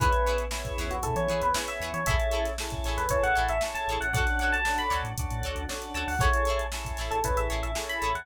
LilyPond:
<<
  \new Staff \with { instrumentName = "Electric Piano 1" } { \time 4/4 \key a \mixolydian \tempo 4 = 116 b'8. r4 fis'16 a'16 cis''8 b'16 r16 e''8 cis''16 | e''8. r4 b'16 cis''16 fis''8 e''16 r16 a''8 fis''16 | fis''8 fis''16 a''8 b''16 r2 a''16 fis''16 | cis''8. r4 a'16 b'16 e''8 e''16 r16 b''8 fis''16 | }
  \new Staff \with { instrumentName = "Pizzicato Strings" } { \time 4/4 \key a \mixolydian <e' gis' b' cis''>8 <e' gis' b' cis''>4 <e' gis' b' cis''>4 <e' gis' b' cis''>4 <e' gis' b' cis''>8 | <e' gis' a' cis''>8 <e' gis' a' cis''>4 <e' gis' a' cis''>4 <e' gis' a' cis''>4 <e' gis' a' cis''>8 | <fis' a' cis'' d''>8 <fis' a' cis'' d''>4 <fis' a' cis'' d''>4 <fis' a' cis'' d''>4 <fis' a' cis'' d''>8 | <e' gis' a' cis''>8 <e' gis' a' cis''>4 <e' gis' a' cis''>4 <e' gis' a' cis''>4 <e' gis' a' cis''>8 | }
  \new Staff \with { instrumentName = "Drawbar Organ" } { \time 4/4 \key a \mixolydian <b cis' e' gis'>4 <b cis' e' gis'>4 <b cis' e' gis'>4 <b cis' e' gis'>4 | <cis' e' gis' a'>4 <cis' e' gis' a'>4 <cis' e' gis' a'>4 <cis' e' gis' a'>4 | <cis' d' fis' a'>4 <cis' d' fis' a'>4 <cis' d' fis' a'>4 <cis' d' fis' a'>4 | <cis' e' gis' a'>4 <cis' e' gis' a'>4 <cis' e' gis' a'>4 <cis' e' gis' a'>4 | }
  \new Staff \with { instrumentName = "Synth Bass 1" } { \clef bass \time 4/4 \key a \mixolydian e,4. e,16 e,16 b,16 e16 e16 e,8. e,16 e16 | a,,4. a,,16 e,16 a,,16 a,,16 a,,16 a,,8. a,,16 a,,16 | d,4. d,16 a,16 d,16 a,16 d,16 d,8. d,16 d,16 | a,,4. a,,16 a,,16 a,,16 a,,16 a,,16 a,,8. a,,16 e,16 | }
  \new DrumStaff \with { instrumentName = "Drums" } \drummode { \time 4/4 <hh bd>16 hh16 hh16 hh16 sn16 <hh bd>16 <hh sn>16 hh16 <hh bd>16 hh16 hh16 hh16 sn16 hh16 hh16 hh16 | <hh bd>16 hh16 hh16 <hh sn>16 sn16 <hh bd sn>16 <hh sn>16 <hh sn>16 <hh bd>16 hh16 hh16 hh16 sn16 hh16 hh16 hh16 | <hh bd>16 <hh sn>16 hh16 hh16 sn16 hh16 <hh sn>16 hh16 <hh bd>16 hh16 hh16 hh16 sn16 hh16 hh16 hho16 | <hh bd>16 hh16 hh16 hh16 sn16 <hh bd>16 <hh sn>16 hh16 <hh bd>16 hh16 hh16 hh16 sn16 hh16 hh16 hh16 | }
>>